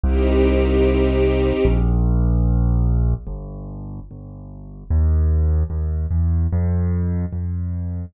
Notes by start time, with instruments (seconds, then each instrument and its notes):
0.03 acoustic grand piano C2, string ensemble 1 C4 D#4 G4
1.65 acoustic grand piano A#1
3.27 acoustic grand piano G1
4.11 acoustic grand piano G1
4.90 acoustic grand piano D#2
5.70 acoustic grand piano D#2
6.11 acoustic grand piano E2
6.52 acoustic grand piano F2
7.32 acoustic grand piano F2